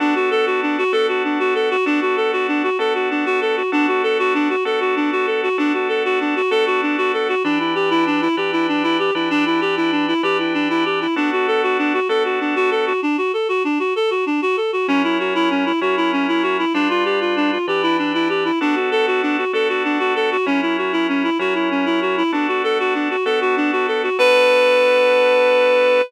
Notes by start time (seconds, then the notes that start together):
0.00 B3 D4 F#4 A4
0.15 F#4
0.31 A4
0.46 F#4
0.62 D4
0.78 F#4
0.92 B3 D4 F#4 A4
1.08 F#4
1.24 D4
1.40 F#4
1.55 A4
1.70 F#4
1.86 B3 D4 F#4 A4
2.02 F#4
2.17 A4
2.33 F#4
2.48 D4
2.63 F#4
2.79 B3 D4 F#4 A4
2.95 F#4
3.10 D4
3.26 F#4
3.41 A4
3.57 F#4
3.72 B3 D4 F#4 A4
3.88 F#4
4.03 A4
4.19 F#4
4.34 D4
4.50 F#4
4.65 B3 D4 F#4 A4
4.80 F#4
4.96 D4
5.12 F#4
5.27 A4
5.43 F#4
5.58 B3 D4 F#4 A4
5.74 F#4
5.89 A4
6.05 F#4
6.20 D4
6.36 F#4
6.51 B3 D4 F#4 A4
6.66 F#4
6.82 D4
6.98 F#4
7.14 A4
7.29 F#4
7.44 E3 D4 G4 B4
7.60 E4
7.75 G4
7.90 E4
8.06 D4
8.22 E4
8.37 E3 D4 G4 B4
8.52 E4
8.68 D4
8.83 E4
8.99 G4
9.15 E3 D4 E4 G4 B4
9.30 D4
9.46 E4
9.61 G4
9.77 E4
9.92 D4
10.08 E4
10.23 E3 D4 G4 B4
10.39 E4
10.54 D4
10.70 E4
10.85 G4
11.01 E4
11.16 B3 D4 F#4 A4
11.32 F#4
11.48 A4
11.63 F#4
11.78 D4
11.94 F#4
12.09 B3 D4 F#4 A4
12.25 F#4
12.40 D4
12.56 F#4
12.71 A4
12.87 F#4
13.02 D4
13.18 F#4
13.33 A4
13.49 F#4
13.64 D4
13.79 F#4
13.96 A4
14.11 F#4
14.26 D4
14.42 F#4
14.57 A4
14.73 F#4
14.88 F#3 C#4 E4 A#4
15.04 E4
15.19 F#4
15.35 E4
15.51 C#4
15.66 E4
15.81 F#3 C#4 E4 F#4 A#4
15.97 E4
16.13 C#4
16.28 E4
16.43 F#4
16.59 E4
16.74 G3 D4 F4 B4
16.90 F4
17.05 G4
17.21 F4
17.36 D4
17.52 F4
17.68 E3 D4 G4 B4
17.83 E4
17.98 D4
18.14 E4
18.29 G4
18.45 E4
18.61 B3 D4 F#4 A4
18.76 F#4
18.91 A4
19.07 F#4
19.22 D4
19.38 F#4
19.53 B3 D4 F#4 A4
19.69 F#4
19.84 D4
19.99 F#4
20.16 A4
20.32 F#4
20.46 F#3 C#4 E4 A#4
20.62 E4
20.78 F#4
20.93 E4
21.09 C#4
21.24 E4
21.39 F#3 C#4 E4 F#4 A#4
21.55 E4
21.71 C#4
21.86 E4
22.02 F#4
22.17 E4
22.32 B3 D4 F#4 A4
22.48 F#4
22.64 A4
22.80 F#4
22.94 D4
23.10 F#4
23.25 B3 D4 F#4 A4
23.41 F#4
23.57 D4
23.72 F#4
23.88 A4
24.03 F#4
24.19 B3 D4 F#4 A4 B4